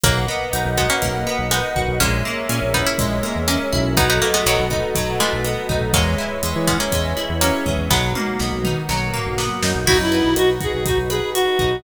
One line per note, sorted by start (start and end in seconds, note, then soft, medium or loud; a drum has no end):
0.03 0.26 B1 loud
0.03 0.66 F#3 medium
0.03 0.66 A#3 medium
0.03 1.02 A#3 loud
0.03 1.98 A#4 medium
0.03 1.98 B4 medium
0.03 1.98 D#5 medium
0.03 1.98 F#5 medium
0.03 kick loud
0.03 cross-stick loud
0.03 closed hi-hat loud
0.28 1.26 B3 medium
0.53 0.64 B1 medium
0.53 1.51 D#4 medium
0.53 closed hi-hat loud
0.65 0.87 B1 loud
0.77 0.89 G#3 medium
0.77 0.89 B3 medium
0.77 1.75 F#4 medium
0.77 kick medium
0.77 cross-stick loud
0.90 1.41 A#3 medium
0.90 1.41 C#4 medium
1.02 1.25 B1 medium
1.02 1.96 A#3 medium
1.02 kick medium
1.02 closed hi-hat loud
1.27 1.97 B3 loud
1.39 1.61 B1 medium
1.51 1.91 G#3 medium
1.51 1.91 B3 medium
1.51 1.98 D#4 medium
1.51 cross-stick loud
1.51 closed hi-hat loud
1.76 1.87 B1 medium
1.76 1.99 F#4 medium
1.76 kick medium
1.88 1.99 B1 medium
2.00 2.23 A#1 loud
2.00 2.98 G#3 loud
2.00 2.64 A#3 medium
2.00 2.64 C#4 medium
2.00 3.95 G#4 medium
2.00 3.95 A#4 medium
2.00 3.95 C#5 medium
2.00 3.95 E5 medium
2.00 kick medium
2.00 closed hi-hat loud
2.25 3.23 A#3 loud
2.49 2.60 A#2 medium
2.49 3.47 C#4 loud
2.49 cross-stick medium
2.49 closed hi-hat loud
2.62 2.84 A#1 medium
2.74 2.86 B3 medium
2.74 2.86 D#4 medium
2.74 3.72 E4 medium
2.74 kick medium
2.86 3.42 C#4 medium
2.86 3.42 E4 medium
2.98 3.22 A#1 medium
2.98 3.92 G#3 medium
2.98 kick medium
2.98 closed hi-hat loud
3.23 3.93 A#3 medium
3.23 cross-stick medium
3.35 3.57 E2 medium
3.48 3.92 A#3 medium
3.48 3.92 C#4 medium
3.48 3.94 C#4 medium
3.48 closed hi-hat loud
3.73 4.20 B1 loud
3.73 3.96 E4 loud
3.73 kick medium
3.97 4.95 F#3 loud
3.97 4.09 B3 medium
3.97 4.09 D#4 loud
3.97 5.92 F#4 medium
3.97 5.92 A4 medium
3.97 5.92 B4 medium
3.97 5.92 D#5 medium
3.97 kick loud
3.97 cross-stick loud
3.97 closed hi-hat loud
4.10 4.21 B3 medium
4.10 4.21 D#4 medium
4.22 5.19 A3 medium
4.22 4.33 A#3 medium
4.34 4.45 G#3 medium
4.34 4.45 B3 medium
4.46 4.57 B1 medium
4.46 4.66 D#3 medium
4.46 4.66 F#3 medium
4.46 5.44 B3 medium
4.46 closed hi-hat loud
4.59 4.81 B1 medium
4.70 5.69 D#4 medium
4.70 kick medium
4.70 cross-stick medium
4.95 5.18 B1 medium
4.95 5.89 F#3 loud
4.95 kick medium
4.95 closed hi-hat loud
5.20 5.87 E3 medium
5.20 5.87 G#3 medium
5.20 5.90 A3 medium
5.33 5.55 B1 medium
5.44 5.91 B3 medium
5.44 cross-stick medium
5.44 closed hi-hat medium
5.69 5.80 B1 medium
5.69 5.92 D#4 medium
5.69 kick medium
5.81 5.92 B1 medium
5.93 6.16 E2 loud
5.93 6.55 F#3 medium
5.93 6.43 G#3 loud
5.93 6.55 A#3 medium
5.93 7.89 G#4 medium
5.93 7.89 B4 medium
5.93 7.89 C#5 medium
5.93 7.89 E5 medium
5.93 kick loud
5.93 closed hi-hat loud
6.18 7.16 E4 medium
6.43 6.54 E2 medium
6.43 6.91 G#3 medium
6.43 cross-stick medium
6.43 closed hi-hat loud
6.56 6.78 E3 loud
6.67 6.79 G#3 medium
6.67 6.79 B3 medium
6.67 7.41 C#4 loud
6.67 kick medium
6.80 7.34 A#3 medium
6.80 7.34 C#4 medium
6.92 7.14 E2 medium
6.92 7.65 G#3 loud
6.92 kick medium
6.92 closed hi-hat loud
7.17 7.87 E4 medium
7.17 cross-stick medium
7.29 7.51 E2 medium
7.41 7.89 F#3 medium
7.41 7.89 A#3 medium
7.41 7.88 C#4 loud
7.41 closed hi-hat loud
7.66 7.77 E2 medium
7.66 7.89 G#3 medium
7.66 kick medium
7.78 7.89 E2 medium
7.90 8.13 B1 loud
7.90 8.88 F#3 loud
7.90 8.54 G#3 medium
7.90 8.88 A#3 medium
7.90 8.54 B3 medium
7.90 8.88 B3 medium
7.90 8.88 D#4 medium
7.90 8.88 F#4 medium
7.90 kick medium
7.90 snare medium
8.15 9.13 A#3 medium
8.15 high tom medium
8.39 8.51 B1 medium
8.39 9.37 B3 medium
8.39 snare medium
8.52 8.74 B1 medium
8.64 9.62 D#4 loud
8.64 mid tom loud
8.89 9.11 B1 medium
8.89 9.82 F#3 loud
8.89 9.86 A#3 medium
8.89 9.86 B3 medium
8.89 9.86 F#4 medium
8.89 9.86 A#4 medium
8.89 snare medium
9.14 9.84 A#3 medium
9.14 floor tom medium
9.26 9.49 B1 medium
9.38 9.85 B3 medium
9.38 snare loud
9.62 9.74 F#2 medium
9.62 9.86 D#4 medium
9.62 snare loud
9.75 9.86 B1 medium
9.86 9.98 B1 medium
9.86 11.82 D#4 medium
9.86 10.36 D#4 loud
9.86 11.74 E4 loud
9.86 9.97 F#4 loud
9.86 11.82 F#4 medium
9.86 11.82 B4 medium
9.86 kick loud
9.86 crash loud
9.99 10.21 F#2 medium
9.99 10.34 E4 loud
10.12 11.10 B4 medium
10.12 closed hi-hat medium
10.24 10.36 B1 medium
10.36 10.59 B1 medium
10.36 10.85 D#4 medium
10.36 10.49 F#4 loud
10.36 cross-stick loud
10.36 closed hi-hat loud
10.60 11.35 F#4 medium
10.60 10.72 G#4 loud
10.60 kick medium
10.60 closed hi-hat medium
10.72 10.96 B1 medium
10.72 10.84 G#4 medium
10.85 11.59 D#4 medium
10.85 10.98 F#4 loud
10.85 kick medium
10.85 closed hi-hat loud
10.98 11.20 B1 medium
11.10 11.30 G#4 loud
11.10 11.80 B4 medium
11.10 cross-stick loud
11.10 closed hi-hat medium
11.34 11.76 F#4 loud
11.34 11.82 F#4 medium
11.34 closed hi-hat loud
11.59 11.82 B1 medium
11.59 11.83 D#4 medium
11.59 kick medium
11.59 closed hi-hat medium